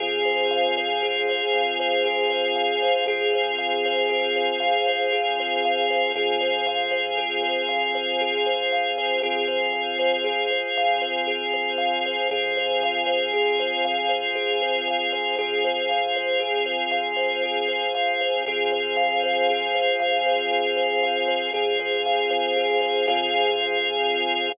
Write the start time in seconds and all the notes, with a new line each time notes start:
0.00 F2 C4 F4 G#4
0.25 C5
0.51 F5
0.78 C5
1.03 G#4
1.29 C5
1.54 F2 F5
1.80 C5
2.05 G#4
2.30 C5
2.56 F5
2.82 C5
3.07 F2 C4 F4 G#4
3.33 C5
3.58 F5
3.86 C5
4.09 G#4
4.36 C5
4.60 F2 F5
4.87 C5
5.13 G#4
5.40 C5
5.65 F5
5.90 C5
6.15 F2 C4 F4 G#4
6.41 C5
6.67 F5
6.91 C5
7.18 G#4
7.43 C5
7.69 F2 F5
7.95 C5
8.21 G#4
8.46 C5
8.72 F5
8.98 C5
9.23 F2 C4 F4 G#4
9.48 C5
9.73 F5
9.99 C5
10.24 G#4
10.50 C5
10.77 F2 F5
11.02 C5
11.27 G#4
11.54 C5
11.78 F5
12.06 C5
12.31 F2 C4 F4 G#4
12.57 C5
12.83 F5
13.06 C5
13.33 G#4
13.60 C5
13.85 F2 F5
14.09 C5
14.35 G#4
14.62 C5
14.88 F5
15.13 C5
15.38 F2 C4 F4 G#4
15.65 C5
15.89 F5
16.16 C5
16.40 G#4
16.66 C5
16.92 F2 F5
17.16 C5
17.43 G#4
17.68 C5
17.95 F5
18.21 C5
18.46 F2 C4 F4 G#4
18.72 C5
18.97 F5
19.24 C5
19.50 G#4
19.75 C5
20.00 F2 F5
20.26 C5
20.51 G#4
20.77 C5
21.03 F5
21.28 C5
21.54 F2 C4 F4 G#4
21.80 C5
22.06 F5
22.30 F2 C5
22.57 G#4
22.82 C5
23.08 F2 C4 F4 G#4 C5 F5